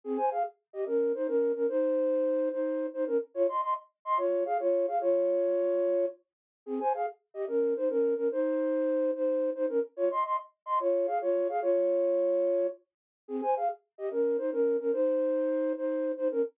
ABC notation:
X:1
M:12/8
L:1/8
Q:3/8=145
K:Ab
V:1 name="Flute"
[CA] [ca] [Af] z2 [Ge] [DB]2 [Ec] [DB]2 [DB] | [Ec]6 [Ec]3 [Ec] [DB] z | [Fd] [ec'] [ec'] z2 [ec'] [Fd]2 [Af] [Fd]2 [Af] | [Fd]8 z4 |
[CA] [ca] [Af] z2 [Ge] [DB]2 [Ec] [DB]2 [DB] | [Ec]6 [Ec]3 [Ec] [DB] z | [Fd] [ec'] [ec'] z2 [ec'] [Fd]2 [Af] [Fd]2 [Af] | [Fd]8 z4 |
[CA] [ca] [Af] z2 [Ge] [DB]2 [Ec] [DB]2 [DB] | [Ec]6 [Ec]3 [Ec] [DB] z |]